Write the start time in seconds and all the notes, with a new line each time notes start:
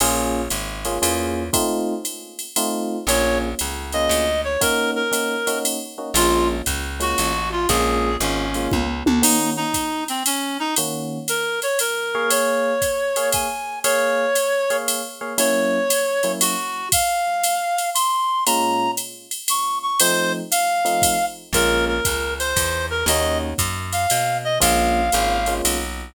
0.00 A#1 A#3 C#4 F4 G#4, crash, ride
0.50 G#1, hi-hat pedal, ride
0.85 A#3 C#4 F4 G#4, ride
1.02 E2 A#3 C#4 F4 G#4, ride
1.53 A3 C4 D#4 F4, kick, ride
2.05 hi-hat pedal, ride
2.39 ride
2.56 A3 C4 D#4 F4, ride
3.07 A#1 A#3 C#4 F4 G#4 C#5, ride
3.59 C#2, hi-hat pedal, ride
3.92 A#3 C#4 F4 G#4 D#5, ride
4.09 D2, ride
4.44 C#5
4.61 A#3 C#4 D#4 F#4 A#4, kick, ride
4.96 A#4
5.12 A#3 C#4 D#4 F#4, hi-hat pedal, ride
5.47 A#3 C#4 D#4 F#4, ride
5.65 ride
5.98 A#3 C#4 D#4 F#4
6.14 A#1 G#3 A#3 C#4 F4, ride
6.66 C#2, kick, hi-hat pedal, ride
7.00 G#3 A#3 C#4 F4 F#4, ride
7.18 A1, ride
7.52 F4
7.69 A#1 G#3 A#3 C#4 F4 G#4, kick, ride
8.20 G#1 G#3 A#3 C#4 F4, hi-hat pedal, ride
8.54 G#3 A#3 C#4 F4, ride
8.71 C#2, kick, high tom
9.06 D2, high tom
9.22 D#3 A#3 C#4 D#4 F#4, crash, ride
9.57 D#4
9.74 kick, hi-hat pedal, ride
10.08 C4, ride
10.26 C#4, ride
10.60 D#4
10.76 D#3 A#3 C#4 F#4, ride
11.28 A#4, hi-hat pedal, ride
11.62 C#5, ride
11.79 A#4, ride
12.15 A#3 G#4 C#5 F5
12.30 C#5, ride
12.82 kick, hi-hat pedal, ride
13.16 A#3 G#4 C#5 F5, ride
13.32 G#5, kick, ride
13.84 A#3 G#4 C#5 F5, ride
14.35 hi-hat pedal, ride
14.70 A#3 G#4 C#5 F5, ride
14.88 ride
15.21 A#3 G#4 C#5 F5
15.38 F#3 A#3 C#4 E4 C#5, ride
15.90 hi-hat pedal, ride
16.23 F#3 A#3 C#4 E4, ride
16.41 F#4, ride
16.92 F5, kick, ride
17.43 hi-hat pedal, ride
17.78 ride
17.95 C6, ride
18.46 A#2 G#3 C#4 F4 A#5, ride
18.97 hi-hat pedal, ride
19.31 ride
19.48 C#6, ride
19.83 C#6
20.00 F3 A3 C4 D#4 C5, ride
20.51 F5, hi-hat pedal, ride
20.85 F3 A3 C4 D#4, ride
21.02 kick, ride
21.53 A#1 G#3 A#3 C#4 F4 A#4, kick, ride
21.88 A#4
22.05 C#2, kick, hi-hat pedal, ride
22.39 C5, ride
22.56 E2, kick, ride
22.90 A#4
23.06 D#2 A#3 C#4 D#4 F#4 D#5, ride
23.58 F#2, kick, hi-hat pedal, ride
23.93 F5, ride
24.10 B2, ride
24.44 D#5
24.60 A#1 G#3 A#3 C#4 F4 F5, kick, ride
25.12 G#1 G#3 A#3 C#4 F4, hi-hat pedal, ride
25.46 G#3 A#3 C#4 F4, ride
25.65 B1, ride